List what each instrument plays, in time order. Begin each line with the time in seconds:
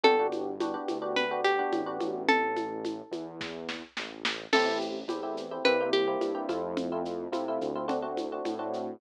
0.04 synth bass 1 G1, electric piano 1 B3 D4 F#4 G4, acoustic guitar (steel) A4, low conga, shaker
0.19 electric piano 1 B3 D4 F#4 G4
0.32 high conga, shaker
0.60 electric piano 1 B3 D4 F#4 G4, high conga, shaker
0.74 electric piano 1 B3 D4 F#4 G4
0.88 synth bass 1 D2, high conga, shaker
1.02 electric piano 1 B3 D4 F#4 G4
1.16 acoustic guitar (steel) B4, low conga, shaker
1.31 electric piano 1 B3 D4 F#4 G4
1.44 acoustic guitar (steel) G4, shaker
1.59 electric piano 1 B3 D4 F#4 G4
1.72 synth bass 1 A1, high conga, shaker
1.86 electric piano 1 B3 D4 F#4 G4
2.00 synth bass 1 A1, high conga, shaker
2.28 acoustic guitar (steel) A4, low conga, shaker
2.56 high conga, shaker
2.85 high conga, shaker
3.11 synth bass 1 E2, high conga, shaker
3.41 kick, snare
3.69 snare
3.97 synth bass 1 A1, snare
4.25 snare
4.53 synth bass 1 A1, electric piano 1 A3 C4 E4 G4, acoustic guitar (steel) A4, crash, low conga, shaker
4.66 electric piano 1 A3 C4 E4 G4
4.81 shaker
5.08 synth bass 1 E2, electric piano 1 A3 C4 E4 G4, high conga, shaker
5.23 electric piano 1 A3 C4 E4 G4
5.37 shaker
5.51 electric piano 1 A3 C4 E4 G4
5.64 synth bass 1 C2, electric piano 1 A#3 C4 E4 G4, acoustic guitar (steel) B4, low conga, shaker
5.80 electric piano 1 A#3 C4 E4 G4
5.93 acoustic guitar (steel) G4, high conga, shaker
6.07 electric piano 1 A#3 C4 E4 G4
6.21 synth bass 1 G2, high conga, shaker
6.35 electric piano 1 A#3 C4 E4 G4
6.49 synth bass 1 F2, electric piano 1 A3 C4 E4 F4, high conga, shaker
6.77 low conga, shaker
6.92 electric piano 1 A3 C4 E4 F4
7.05 shaker
7.32 synth bass 1 C3, electric piano 1 A3 C4 E4 F4, high conga, shaker
7.48 electric piano 1 A3 C4 E4 F4
7.61 synth bass 1 D2, shaker
7.75 electric piano 1 A3 C4 E4 F4
7.88 electric piano 1 A3 C4 D4 F#4, low conga, shaker
8.02 electric piano 1 A3 C4 D4 F#4
8.17 high conga, shaker
8.32 electric piano 1 A3 C4 D4 F#4
8.45 synth bass 1 A2, high conga, shaker
8.59 electric piano 1 A3 C4 D4 F#4
8.73 shaker